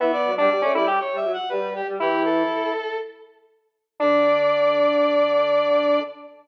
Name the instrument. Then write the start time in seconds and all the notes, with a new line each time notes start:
lead 1 (square)
0.00 E3 B3 E5
0.13 D5
0.25 F#3
0.37 G3 D4 D5
0.50 G3
0.62 A3 C#4
0.75 G3 E4 D5
0.88 G4
1.00 C#5
1.13 G3 E5
1.25 F#3
1.33 F#5
1.49 G3 B4
1.75 G4
1.87 G3
2.00 E3 E4 G4
2.25 A4
4.00 D3 D4 D5